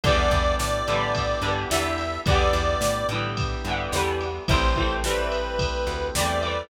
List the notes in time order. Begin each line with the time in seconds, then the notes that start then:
0.04 E2 D3 E3 G3 B3 D4 E4 G4 D5, kick, ride
0.08 B3
0.31 E2, kick, ride
0.59 A2 D5, snare
0.88 A2 D3 E3 G3, ride
0.93 B3
1.15 kick, ride
1.42 G2 D3 E3 G3, ride
1.47 B3
1.70 E2 D3 E3 G3 E5, snare
1.74 B3
1.98 ride
2.26 E2 D3 E3 G3 B3 D4 E4 G4 D5, kick, ride
2.31 B3
2.53 E2, ride
2.81 A2, snare
3.09 A2 D3 E3, ride
3.14 G3 B3
3.37 kick, ride
3.65 G2 D3 E3, ride
3.70 G3 B3
3.92 E2 D3 E3 G3, snare
3.97 B3
4.21 ride
4.48 A1 E3 G3 A3 C4 E4 G4 C5, kick, ride
4.53 C4
4.76 E3 G3 A3, kick, ride
4.81 C4
5.03 E3 G3 A3 B4, snare
5.08 C4
5.32 ride
5.59 kick, ride
5.87 D2, ride
6.15 E2 E3 G3 A3 D5, snare
6.20 C4
6.41 E3 G3 A3, ride
6.46 C4